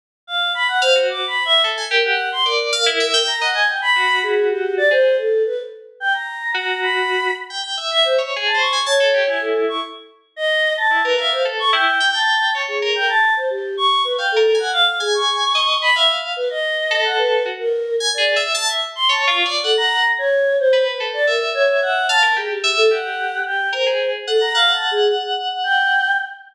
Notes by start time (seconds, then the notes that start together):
0.27 F5
0.54 B5
0.68 F#5
0.82 C5 F5
0.95 F#4
1.09 D6
1.27 B5
1.45 E5
1.64 A4
1.78 G#5
1.91 G4 A#4
2.05 F#5
2.32 C6
2.46 A#4 D5
2.73 F5
2.86 E4
3.00 E5
3.14 G5
3.27 A#5
3.41 D#5 F#5
3.54 G#5
3.68 G5
3.82 B5
3.96 F#4
4.23 G#4
4.50 G4
4.77 D5
4.91 G#4 C5
5.18 A4
5.46 B4
6.00 G5
6.14 A#5
6.54 F#4 A#5
6.82 B5
7.50 G5
7.64 G5
7.77 E5
7.91 E5
8.05 C5
8.18 C#5
8.36 G#4
8.45 A5
8.54 C5
8.59 C#6
8.73 G#5
8.86 C#5 A5
9.00 A4
9.14 G4
9.27 E4 G#5
9.41 A4
9.68 C#6
10.36 D#5
10.77 A5
10.91 E4
11.05 A#4 B4
11.18 E5 F5
11.32 C5
11.45 A4
11.59 C#6
11.73 E4 G5
12.00 G5
12.14 A5
12.55 C#5
12.68 G#4
12.82 A#4
12.95 G5
13.09 A5
13.36 C5
13.50 G4
13.77 C#6
14.04 B4
14.18 F5 G5
14.32 A4
14.36 A#4
14.55 G#5
14.59 F#5
14.73 F5
14.86 F5
15.00 G#4 G#5
15.14 C#6
15.55 D#5
15.82 B5
15.95 E5 F5
16.36 B4
16.50 D#5
16.91 A4
17.05 F#5
17.18 B4
17.45 F#4
17.59 A#4
18.00 G#5
18.14 D5
18.18 G#4
18.36 E5
18.54 A5
18.68 E5
18.95 C6
19.09 C#5 A5
19.23 C#6
19.27 F4
19.36 C#6
19.45 D5
19.64 A4 F#5
19.77 A#5
20.18 C#5
20.59 C5
20.73 B4
20.86 B4
21.00 A4
21.13 D5
21.27 A#4 E5
21.55 C#5
21.68 C#5
21.82 F#5
22.09 F5 A5
22.23 A#4
22.36 G4 G#4
22.50 G4
22.64 E5
22.77 A4
22.91 G4 F#5
23.45 G5
23.73 A#4 C5
23.86 G#4
24.27 A4 F#5
24.41 A#5
24.55 F5 F#5
24.73 A5
24.91 G#4
25.64 G5